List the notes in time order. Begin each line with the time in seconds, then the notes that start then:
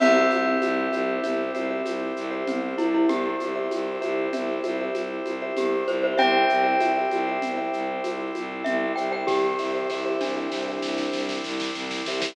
0.00 C2 C4 E4 G4 C5 E5, crash, low conga, shaker
0.31 C2, high conga, shaker
0.46 G4 C5 E5
0.62 C2, high conga, shaker
0.92 C2 G4 C5 E5, high conga, shaker
1.23 C2 G4 C5 E5, low conga, shaker
1.55 C2 G4 C5 E5, high conga, shaker
1.70 G4 C5 E5
1.85 C2, high conga, shaker
2.16 C2, shaker
2.31 G4 C5 E5
2.47 C2 C4, low conga, shaker
2.78 C2 E4, high conga, shaker
2.94 E4 G4 C5 E5
3.09 C2 G4, low conga, shaker
3.40 C2, high conga, shaker
3.56 G4 C5 E5
3.71 C2, high conga, shaker
4.01 C2 G4 C5 E5, high conga, shaker
4.33 C2 G4 C5 E5, low conga, shaker
4.64 C2 G4 C5 E5, high conga, shaker
4.81 G4 C5 E5
4.94 C2, high conga, shaker
5.25 C2, high conga, shaker
5.42 G4 C5 E5
5.57 C2 G4, low conga, shaker
5.88 C2 C5, high conga, shaker
6.03 G4 C5 E5
6.18 C2 C4 E4 G4 C5 E5 G5, low conga, shaker
6.49 C2 G4 C5 E5, shaker
6.64 G4 C5 E5
6.80 C2 G4 C5 E5, high conga, shaker
6.97 G4 C5 E5
7.11 C2, high conga, shaker
7.27 G4 C5 E5
7.42 C2, low conga, shaker
7.57 G4 C5 E5
7.73 C2, shaker
8.04 C2, high conga, shaker
8.35 C2, high conga, shaker
8.64 C2 E5, low conga, shaker
8.96 C2 G4 C5 E5 G5, shaker
9.12 G4 C5 E5 G5
9.27 C2 G4, kick, snare
9.59 C2 G4 C5 E5, snare
9.75 G4 C5 E5
9.90 C2 G4 C5 E5, snare
10.06 G4 C5 E5
10.21 C2 D4, snare
10.37 G4 C5 E5
10.52 C2, snare
10.68 G4 C5 E5
10.82 C2, snare
10.98 snare
11.13 C2, snare
11.29 snare
11.44 C2, snare
11.60 snare
11.75 C2, snare
11.91 snare
12.06 C2 G4 C5 E5, snare
12.21 G4 C5 E5, snare